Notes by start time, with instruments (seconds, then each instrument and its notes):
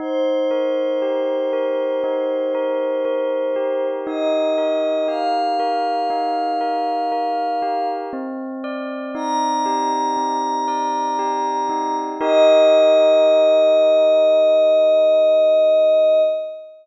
0.00 tubular bells D#4, pad 5 (bowed) C5
0.51 tubular bells A#4
1.02 tubular bells G4
1.53 tubular bells A#4
2.04 tubular bells D#4
2.55 tubular bells A#4
3.05 tubular bells A#4
3.56 tubular bells G4
4.07 tubular bells D#4, pad 5 (bowed) D#5
4.58 tubular bells A#4
5.08 tubular bells G4, pad 5 (bowed) F5
5.60 tubular bells A#4
6.10 tubular bells D#4
6.61 tubular bells A#4
7.12 tubular bells A#4
7.62 tubular bells G4
8.13 tubular bells C4
8.64 tubular bells D5
9.15 tubular bells D#4, pad 5 (bowed) A#5
9.66 tubular bells G4
10.17 tubular bells C4
10.68 tubular bells D5
11.19 tubular bells G4
11.69 tubular bells D#4
12.21 tubular bells D#4 G4 A#4, pad 5 (bowed) D#5